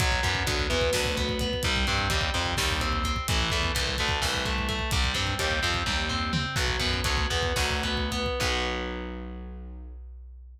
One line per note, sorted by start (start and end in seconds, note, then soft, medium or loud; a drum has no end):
0.00 0.20 B1 loud
0.00 0.46 F#3 loud
0.00 kick loud
0.00 closed hi-hat loud
0.12 kick medium
0.23 0.43 F#2 loud
0.23 0.70 B3 loud
0.23 kick loud
0.23 closed hi-hat medium
0.35 kick loud
0.47 0.67 D2 medium
0.47 0.93 F#3 medium
0.47 kick loud
0.47 closed hi-hat loud
0.59 kick medium
0.70 0.90 E2 loud
0.70 1.17 B3 medium
0.70 kick medium
0.70 closed hi-hat medium
0.81 kick loud
0.93 1.54 D2 loud
0.93 1.61 F#3 loud
0.93 kick medium
0.93 snare loud
1.05 kick loud
1.17 1.40 B3 medium
1.17 kick loud
1.17 closed hi-hat medium
1.29 kick loud
1.39 1.63 B3 medium
1.39 kick loud
1.39 closed hi-hat medium
1.53 kick medium
1.63 1.84 C2 loud
1.63 2.10 G3 loud
1.63 kick loud
1.63 closed hi-hat loud
1.76 kick loud
1.87 2.08 G2 loud
1.87 2.34 C4 medium
1.87 kick medium
1.87 closed hi-hat medium
1.99 kick medium
2.10 2.30 D#2 medium
2.10 2.57 G3 medium
2.10 kick loud
2.10 closed hi-hat loud
2.21 kick loud
2.34 2.54 F2 loud
2.34 2.81 C4 medium
2.34 kick medium
2.34 closed hi-hat medium
2.46 kick medium
2.57 3.17 D#2 loud
2.57 3.24 G3 medium
2.57 kick loud
2.57 snare loud
2.70 kick loud
2.80 3.04 C4 medium
2.80 kick medium
2.80 closed hi-hat medium
2.93 kick medium
3.04 3.27 C4 medium
3.04 kick medium
3.04 closed hi-hat medium
3.16 kick loud
3.28 3.49 A1 loud
3.28 3.74 E3 loud
3.28 kick loud
3.28 closed hi-hat loud
3.39 kick medium
3.50 3.71 E2 medium
3.50 3.98 A3 medium
3.50 kick loud
3.50 closed hi-hat medium
3.63 kick medium
3.75 3.96 C2 loud
3.75 4.21 E3 medium
3.75 kick medium
3.75 closed hi-hat loud
3.87 kick medium
3.98 4.20 D2 loud
3.98 4.45 A3 medium
3.98 kick medium
3.98 closed hi-hat medium
4.09 kick loud
4.22 4.81 C2 medium
4.22 4.89 E3 loud
4.22 kick loud
4.22 snare loud
4.34 kick medium
4.45 4.68 A3 medium
4.45 kick loud
4.45 closed hi-hat medium
4.58 kick medium
4.69 4.91 A3 medium
4.69 kick loud
4.69 closed hi-hat medium
4.79 kick medium
4.91 5.12 C2 loud
4.91 5.38 G3 loud
4.91 kick loud
4.91 closed hi-hat loud
5.04 kick loud
5.14 5.34 G2 medium
5.14 5.62 C4 medium
5.14 kick medium
5.14 closed hi-hat medium
5.27 kick medium
5.39 5.59 D#2 loud
5.39 5.86 G3 medium
5.39 kick medium
5.39 closed hi-hat loud
5.51 kick medium
5.62 5.83 F2 loud
5.62 6.09 C4 medium
5.62 kick medium
5.62 closed hi-hat medium
5.74 kick loud
5.86 6.46 D#2 medium
5.86 6.53 G3 medium
5.86 kick medium
5.86 high tom medium
6.09 6.32 C4 loud
6.09 floor tom loud
6.33 6.55 C4 medium
6.33 mid tom loud
6.56 6.76 B1 loud
6.56 7.04 F#3 loud
6.56 kick loud
6.56 crash loud
6.68 kick medium
6.80 7.00 F#2 loud
6.80 7.30 B3 medium
6.80 kick loud
6.80 closed hi-hat medium
6.94 kick medium
7.04 7.26 D2 medium
7.04 7.56 F#3 medium
7.04 kick loud
7.04 closed hi-hat loud
7.17 kick loud
7.30 7.53 E2 medium
7.30 7.83 B3 medium
7.30 kick medium
7.30 closed hi-hat medium
7.43 kick loud
7.56 8.28 D2 loud
7.56 8.36 F#3 loud
7.56 kick loud
7.56 snare loud
7.70 kick medium
7.83 8.11 B3 medium
7.83 kick medium
7.83 closed hi-hat medium
7.97 kick medium
8.11 8.39 B3 medium
8.11 kick medium
8.11 closed hi-hat medium
8.26 kick medium
8.40 10.59 B1 loud
8.40 10.60 F#3 loud
8.40 10.60 B3 medium
8.40 kick loud
8.40 crash loud